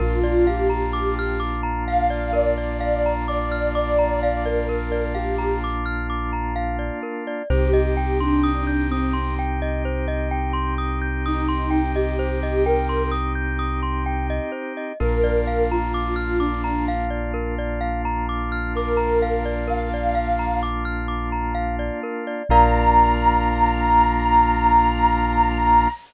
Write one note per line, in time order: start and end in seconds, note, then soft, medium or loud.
0.00 6.91 A#1 medium
0.00 7.42 A#3 medium
0.00 7.42 D4 medium
0.00 7.42 F4 medium
0.00 0.46 F4 medium
0.00 0.20 A#4 loud
0.23 0.45 D5 medium
0.47 1.38 G4 medium
0.47 0.68 F5 medium
0.70 0.91 A#5 medium
0.93 1.14 D6 medium
1.19 1.40 F6 medium
1.40 1.61 D6 medium
1.63 1.84 A#5 medium
1.88 2.09 F5 medium
1.88 2.32 F5 medium
2.10 2.31 D5 medium
2.33 2.54 A#4 medium
2.33 3.13 D5 medium
2.58 2.79 D5 medium
2.80 3.02 F5 medium
3.06 3.27 A#5 medium
3.28 3.71 D5 medium
3.28 3.49 D6 medium
3.52 3.73 F6 medium
3.75 4.42 D5 medium
3.75 3.96 D6 medium
3.99 4.20 A#5 medium
4.23 4.44 F5 medium
4.45 5.04 A#4 medium
4.45 4.67 D5 medium
4.69 4.90 A#4 medium
4.92 5.13 D5 medium
5.15 5.56 G4 medium
5.15 5.36 F5 medium
5.38 5.59 A#5 medium
5.64 5.85 D6 medium
5.86 6.07 F6 medium
6.10 6.31 D6 medium
6.33 6.54 A#5 medium
6.56 6.77 F5 medium
6.79 7.00 D5 medium
7.03 7.24 A#4 medium
7.27 7.48 D5 medium
7.50 14.40 C2 loud
7.50 14.92 C4 medium
7.50 14.92 D#4 medium
7.50 14.92 G4 medium
7.50 8.17 G4 medium
7.50 7.71 C5 loud
7.73 7.94 D#5 medium
7.97 8.18 G5 medium
8.20 8.84 D4 medium
8.20 8.42 C6 medium
8.44 8.65 D#6 medium
8.67 8.88 G6 medium
8.90 9.28 C4 medium
8.90 9.13 D#6 medium
9.13 9.34 C6 medium
9.39 9.60 G5 medium
9.62 9.83 D#5 medium
9.85 10.06 C5 medium
10.08 10.29 D#5 medium
10.31 10.52 G5 medium
10.53 10.74 C6 medium
10.78 10.99 D#6 medium
11.02 11.23 G6 medium
11.26 11.83 D#4 medium
11.26 11.47 D#6 medium
11.48 11.70 C6 medium
11.71 11.92 G5 medium
11.95 12.63 G4 medium
11.95 12.17 D#5 medium
12.19 12.40 C5 medium
12.43 12.64 D#5 medium
12.65 13.03 A#4 medium
12.65 12.87 G5 medium
12.89 13.10 C6 medium
13.12 13.33 D#6 medium
13.35 13.56 G6 medium
13.59 13.80 D#6 medium
13.83 14.04 C6 medium
14.06 14.27 G5 medium
14.30 14.51 D#5 medium
14.52 14.73 C5 medium
14.77 14.98 D#5 medium
15.00 21.91 A#1 medium
15.00 22.42 A#3 medium
15.00 22.42 D4 medium
15.00 22.42 F4 medium
15.00 15.21 A#4 medium
15.00 15.61 A#4 medium
15.24 15.45 D5 medium
15.47 15.68 F5 medium
15.71 16.38 F4 medium
15.71 15.93 A#5 medium
15.94 16.15 D6 medium
16.16 16.37 F6 medium
16.39 16.85 D4 medium
16.39 16.61 D6 medium
16.64 16.85 A#5 medium
16.88 17.09 F5 medium
17.10 17.31 D5 medium
17.34 17.55 A#4 medium
17.59 17.80 D5 medium
17.81 18.02 F5 medium
18.05 18.26 A#5 medium
18.29 18.50 D6 medium
18.52 18.73 F6 medium
18.75 19.56 A#4 medium
18.75 18.98 D6 medium
18.97 19.18 A#5 medium
19.22 19.43 F5 medium
19.45 19.66 D5 medium
19.68 19.89 A#4 medium
19.68 20.54 F5 medium
19.94 20.15 D5 medium
20.15 20.36 F5 medium
20.39 20.60 A#5 medium
20.63 20.84 D6 medium
20.85 21.06 F6 medium
21.08 21.29 D6 medium
21.32 21.53 A#5 medium
21.55 21.76 F5 medium
21.79 22.00 D5 medium
22.03 22.24 A#4 medium
22.27 22.48 D5 medium
22.49 25.87 A#1 loud
22.49 25.88 A#3 loud
22.49 25.88 D4 loud
22.49 25.88 F4 medium
22.49 25.89 A#4 loud
22.49 25.89 D5 loud
22.49 25.89 F5 medium
22.49 25.88 A#5 loud